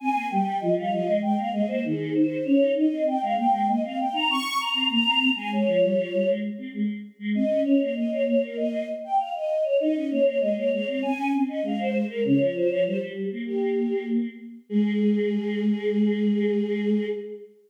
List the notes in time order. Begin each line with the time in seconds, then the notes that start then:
0.00 C4 G#5
0.15 A#3
0.30 G3 G5
0.60 F3 D#5
0.77 G3 F5
0.91 F3 D#5
1.06 G#3
1.22 G#3 G5
1.37 A#3 F5
1.52 G#3 D#5
1.68 A#3 C5
1.84 D#3 G#4
2.15 C5
2.45 C#4 C#5
2.60 D#4
2.77 D#5
2.91 C4
3.07 G5
3.22 G#3 F5
3.37 A#3 G5
3.52 G#3
3.67 A#3 D#5
3.84 C4 F5
3.99 G5
4.13 D#4 A#5
4.29 C4 C#6
4.59 A#5
4.74 C4
4.89 A#3 A#5
5.05 C4
5.36 G#3 G#5
5.53 C#5
5.66 F3
5.82 G3
5.97 F3
6.13 G3
6.27 G#3
6.58 C4
6.73 G#3
7.19 G#3
7.35 C4 D#5
7.49 C#4
7.64 C#4 C#5
7.80 A#3 C#5
7.96 D#5
8.11 C#5
8.27 C#5
8.43 A#4
8.57 D#5
9.04 G5
9.18 F5
9.34 D#5
9.64 C#5
9.79 D#4 D#5
9.94 C#4
10.10 A#3 C#5
10.25 C#5
10.40 G#3 D#5
10.55 A#3 C#5
10.72 G#3 C#5
10.87 C4 C#5
11.02 C4 G#5
11.17 C#4
11.33 C4
11.48 C#4 D#5
11.62 G#3 F5
11.79 C5
12.09 A#4
12.24 C#3 C#5
12.40 F3 C#5
12.55 C5
12.69 F3 C#5
12.85 G3 C5
13.01 G3
13.32 A#3
13.46 G4
14.69 G#3 G#4